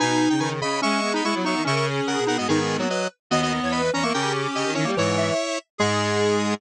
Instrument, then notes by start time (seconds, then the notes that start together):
lead 1 (square)
0.00 B2 D#4 B4 G#5
0.30 C#3 G5
0.40 D#3 B4 G#5
0.61 C#3 D#5 B5
0.82 G#3 C#4 E5 C#6
1.02 B3
1.14 D#4 D#5 B5
1.24 G#3 E4 E5 C#6
1.35 F#3
1.44 F#3 D#4 E5 C#6
1.56 D#3
1.65 C#3 C#4 A#4 E5 C#6
1.76 E5 C#6
1.84 G#4
2.06 C#3 A#4 F#5
2.18 B2
2.27 B2 D#4 A#4 F#5
2.38 G#2 B3 F#4 D#5
2.47 G#2 D#3 B3 D#4 G#4
2.70 B3
2.79 F#3 A#3 F#4
2.89 F#4 B4 D#5
3.30 D#2 B3 F#4 D#5
3.43 F#4 D#5
3.52 D#5
3.62 E2 C#5
3.72 B4 D#5 B5
3.94 E2 C#4 C#5 A#5
4.03 A#3 A#4 E5 C#6
4.14 C#3 C#4 G4 A#4 G5
4.55 C#3 G4 D#5
4.66 D#3
4.74 D#3 C#4 E4 C#5
4.85 G3 A#3
4.96 G#2 E3 E4 C#5
5.17 E5
5.78 G#2 G#3 G#4